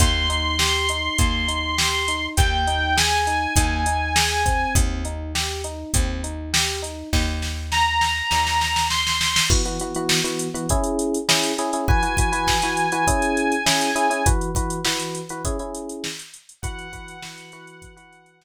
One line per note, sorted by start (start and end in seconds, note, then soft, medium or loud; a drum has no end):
0.00 1.09 D#2 loud
0.00 0.26 A#3 medium
0.00 2.26 C6 medium
0.00 kick medium
0.00 closed hi-hat loud
0.29 0.56 D#4 medium
0.29 closed hi-hat medium
0.59 0.86 G4 medium
0.59 snare loud
0.89 1.16 D#4 medium
0.89 closed hi-hat medium
1.18 2.28 D#2 medium
1.18 1.45 A#3 medium
1.18 kick medium
1.18 closed hi-hat medium
1.48 1.75 D#4 medium
1.48 closed hi-hat medium
1.78 2.05 G4 medium
1.78 snare loud
2.08 2.35 D#4 medium
2.08 closed hi-hat medium
2.37 3.47 D#2 loud
2.37 2.64 A#3 medium
2.37 2.96 G5 medium
2.37 kick medium
2.37 closed hi-hat medium
2.67 2.94 D#4 medium
2.67 closed hi-hat medium
2.97 3.24 G#4 medium
2.97 4.73 G#5 medium
2.97 snare loud
3.27 3.54 D#4 medium
3.27 closed hi-hat medium
3.56 4.66 D#2 loud
3.56 3.84 A#3 medium
3.56 kick medium
3.56 closed hi-hat loud
3.86 4.13 D#4 medium
3.86 closed hi-hat medium
4.16 4.42 G#4 medium
4.16 snare loud
4.46 5.02 C4 medium
4.46 kick medium
4.46 closed hi-hat medium
4.75 5.85 D#2 medium
4.75 kick loud
4.75 closed hi-hat loud
5.05 5.32 D#4 medium
5.05 closed hi-hat medium
5.35 5.62 G4 medium
5.35 snare medium
5.64 5.91 D#4 medium
5.64 closed hi-hat medium
5.94 7.03 D#2 medium
5.94 6.22 C4 medium
5.94 kick medium
5.94 closed hi-hat loud
6.24 6.50 D#4 medium
6.24 closed hi-hat medium
6.53 6.80 G4 medium
6.53 snare loud
6.82 7.09 D#4 medium
6.82 closed hi-hat medium
7.13 8.22 D#2 medium
7.13 kick medium
7.13 snare medium
7.42 snare medium
7.72 8.86 A#5 medium
7.72 snare medium
8.01 snare medium
8.31 9.41 D#2 medium
8.31 snare medium
8.47 snare medium
8.61 snare medium
8.76 snare medium
8.90 9.45 C6 medium
8.90 snare medium
9.07 snare medium
9.21 snare medium
9.36 snare loud
9.50 9.62 E3 loud
9.50 9.62 B3 loud
9.50 9.62 F#4 loud
9.50 kick loud
9.50 crash medium
9.65 9.77 E3 medium
9.65 9.77 B3 medium
9.65 9.77 F#4 medium
9.65 closed hi-hat medium
9.79 9.93 E3 medium
9.79 9.93 B3 medium
9.79 9.93 F#4 medium
9.79 closed hi-hat medium
9.95 10.20 E3 loud
9.95 10.20 B3 medium
9.95 10.20 F#4 loud
9.95 closed hi-hat medium
10.09 snare loud
10.24 10.48 E3 medium
10.24 10.48 B3 medium
10.24 10.48 F#4 medium
10.24 closed hi-hat medium
10.39 closed hi-hat medium
10.54 10.66 E3 loud
10.54 10.66 B3 medium
10.54 10.66 F#4 medium
10.54 closed hi-hat medium
10.69 11.18 C#4 medium
10.69 11.18 E4 loud
10.69 11.18 G#4 loud
10.69 kick medium
10.69 closed hi-hat medium
10.84 closed hi-hat medium
10.99 closed hi-hat medium
11.14 closed hi-hat medium
11.29 11.52 C#4 medium
11.29 11.52 E4 loud
11.29 11.52 G#4 loud
11.29 snare loud
11.43 closed hi-hat medium
11.58 11.70 C#4 medium
11.58 11.70 E4 medium
11.58 11.70 G#4 loud
11.58 closed hi-hat medium
11.73 11.85 C#4 medium
11.73 11.85 E4 medium
11.73 11.85 G#4 medium
11.73 closed hi-hat medium
11.88 12.00 E3 loud
11.88 12.00 F#4 medium
11.88 12.00 B4 loud
11.88 14.25 G#5 medium
11.88 kick loud
12.03 12.15 E3 medium
12.03 12.15 F#4 medium
12.03 12.15 B4 medium
12.03 closed hi-hat medium
12.17 12.30 E3 medium
12.17 12.30 F#4 medium
12.17 12.30 B4 medium
12.17 kick medium
12.17 closed hi-hat medium
12.32 12.56 E3 medium
12.32 12.56 F#4 medium
12.32 12.56 B4 loud
12.32 closed hi-hat medium
12.47 kick medium
12.47 snare medium
12.62 12.87 E3 medium
12.62 12.87 F#4 medium
12.62 12.87 B4 medium
12.62 closed hi-hat medium
12.77 closed hi-hat medium
12.92 13.04 E3 medium
12.92 13.04 F#4 loud
12.92 13.04 B4 medium
12.92 closed hi-hat medium
13.07 13.55 C#4 loud
13.07 13.55 E4 loud
13.07 13.55 G#4 loud
13.07 kick medium
13.07 closed hi-hat loud
13.22 closed hi-hat medium
13.37 closed hi-hat medium
13.52 closed hi-hat medium
13.66 13.90 C#4 medium
13.66 13.90 E4 medium
13.66 13.90 G#4 medium
13.66 snare loud
13.81 closed hi-hat medium
13.96 14.07 C#4 medium
13.96 14.07 E4 loud
13.96 14.07 G#4 loud
13.96 closed hi-hat medium
14.10 14.22 C#4 medium
14.10 14.22 E4 medium
14.10 14.22 G#4 medium
14.10 closed hi-hat medium
14.26 14.50 E3 loud
14.26 14.50 F#4 loud
14.26 14.50 B4 medium
14.26 kick loud
14.26 closed hi-hat loud
14.41 closed hi-hat medium
14.55 14.80 E3 medium
14.55 14.80 F#4 medium
14.55 14.80 B4 medium
14.55 kick medium
14.55 closed hi-hat medium
14.70 closed hi-hat medium
14.85 15.21 E3 medium
14.85 15.21 F#4 medium
14.85 15.21 B4 medium
14.85 snare loud
15.00 closed hi-hat medium
15.15 closed hi-hat medium
15.29 15.42 E3 medium
15.29 15.42 F#4 medium
15.29 15.42 B4 medium
15.29 closed hi-hat medium
15.45 15.57 C#4 loud
15.45 15.57 E4 loud
15.45 15.57 G#4 loud
15.45 kick medium
15.45 closed hi-hat loud
15.59 16.07 C#4 medium
15.59 16.07 E4 medium
15.59 16.07 G#4 medium
15.59 closed hi-hat medium
15.75 closed hi-hat medium
15.89 closed hi-hat medium
16.04 snare loud
16.19 closed hi-hat medium
16.34 closed hi-hat medium
16.49 closed hi-hat medium
16.62 16.87 E3 loud
16.62 16.87 F#4 loud
16.62 16.87 B4 loud
16.62 18.44 F#5 medium
16.62 kick loud
16.62 closed hi-hat loud
16.79 closed hi-hat medium
16.93 17.17 E3 medium
16.93 17.17 F#4 medium
16.93 17.17 B4 medium
16.93 kick medium
16.93 closed hi-hat medium
17.08 closed hi-hat medium
17.22 17.51 E3 medium
17.22 17.51 F#4 medium
17.22 17.51 B4 medium
17.22 snare loud
17.38 closed hi-hat medium
17.52 17.95 E3 loud
17.52 17.95 F#4 loud
17.52 17.95 B4 loud
17.52 closed hi-hat medium
17.67 closed hi-hat medium
17.82 kick medium
17.82 closed hi-hat medium
17.97 18.44 E3 medium
17.97 18.44 F#4 medium
17.97 18.44 B4 medium
17.97 closed hi-hat medium
18.12 closed hi-hat medium
18.26 closed hi-hat medium
18.41 snare loud